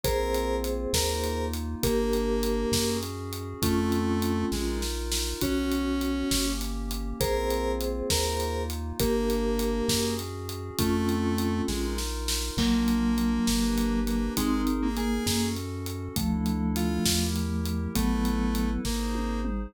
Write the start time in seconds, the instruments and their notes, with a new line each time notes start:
0.03 synth bass 1 A#1, pad 5 (bowed) A#3 C4 F4, vibraphone G#4 C5, lead 1 (square) A#4, kick, closed hi-hat
0.34 closed hi-hat
0.64 closed hi-hat
0.93 synth bass 1 D#2, pad 5 (bowed) A#3 D#4 F4, lead 1 (square) A#4, kick, snare
1.24 closed hi-hat
1.53 closed hi-hat
1.83 synth bass 1 G1, pad 5 (bowed) A#3 D4 G4, lead 1 (square) A#3, vibraphone G4 A#4, kick, closed hi-hat
2.13 closed hi-hat
2.43 closed hi-hat
2.72 synth bass 1 F#2, pad 5 (bowed) C#4 F#4 G#4, kick, snare
3.03 closed hi-hat
3.33 closed hi-hat
3.62 synth bass 1 F2, lead 1 (square) A3, pad 5 (bowed) C4 F4 A4, vibraphone C#4 F4, kick, closed hi-hat
3.92 closed hi-hat
4.22 closed hi-hat
4.52 synth bass 1 A#1, lead 1 (square) G#3, pad 5 (bowed) D#4 F4 A#4, kick, snare
4.82 snare
5.12 snare
5.41 synth bass 1 B1, pad 5 (bowed) B3 C#4 F#4, vibraphone C#4 F#4, lead 1 (square) C#4, kick, closed hi-hat
5.72 closed hi-hat
6.01 closed hi-hat
6.30 synth bass 1 G1, pad 5 (bowed) A#3 C#4 G4, kick, snare
6.61 closed hi-hat
6.91 closed hi-hat
7.20 synth bass 1 A#1, pad 5 (bowed) A#3 C4 F4, vibraphone G#4 C5, lead 1 (square) A#4, kick, closed hi-hat
7.50 closed hi-hat
7.81 closed hi-hat
8.10 synth bass 1 D#2, pad 5 (bowed) A#3 D#4 F4, lead 1 (square) A#4, kick, snare
8.40 closed hi-hat
8.70 closed hi-hat
9.00 synth bass 1 G1, pad 5 (bowed) A#3 D4 G4, lead 1 (square) A#3, vibraphone G4 A#4, kick, closed hi-hat
9.30 closed hi-hat
9.59 closed hi-hat
9.88 synth bass 1 F#2, pad 5 (bowed) C#4 F#4 G#4, kick, snare
10.19 closed hi-hat
10.49 closed hi-hat
10.79 synth bass 1 F2, lead 1 (square) A3, pad 5 (bowed) C4 F4 A4, vibraphone C#4 F4, kick, closed hi-hat
11.09 closed hi-hat
11.38 closed hi-hat
11.68 synth bass 1 A#1, lead 1 (square) G#3, pad 5 (bowed) D#4 F4 A#4, kick, snare
11.98 snare
12.28 snare
12.57 synth bass 1 A#1, vibraphone F#3 A#3, lead 1 (square) A#3, pad 5 (bowed) D4 F4 A#4, kick, crash
12.88 closed hi-hat
13.18 closed hi-hat
13.47 synth bass 1 G1, pad 5 (bowed) D4 G4 B4, kick, snare
13.78 closed hi-hat
14.07 lead 1 (square) A#3, closed hi-hat
14.35 synth bass 1 G#1, lead 1 (square) G#3, vibraphone C4 D#4, pad 5 (bowed) D#4 G#4 A#4, kick, closed hi-hat
14.67 closed hi-hat
14.82 lead 1 (square) A#3
14.97 vibraphone A#3, lead 1 (square) G#4, closed hi-hat
15.26 synth bass 1 F#2, vibraphone A#3, pad 5 (bowed) C#4 F#4 A4, kick, snare
15.56 closed hi-hat
15.86 closed hi-hat
16.16 synth bass 1 D2, vibraphone F3 A3, pad 5 (bowed) D4 E4 A4, kick, closed hi-hat
16.46 closed hi-hat
16.76 lead 1 (square) F4, closed hi-hat
17.05 synth bass 1 E2, pad 5 (bowed) E4 G4 A#4, kick, snare
17.36 closed hi-hat
17.65 closed hi-hat
17.94 synth bass 1 A1, vibraphone F#3 B3, lead 1 (square) A3, pad 5 (bowed) E4 A4 B4, kick, closed hi-hat
18.25 closed hi-hat
18.55 closed hi-hat
18.85 synth bass 1 G#1, lead 1 (square) A#3, pad 5 (bowed) D#4 G#4 C5, kick, snare
19.15 high tom
19.45 mid tom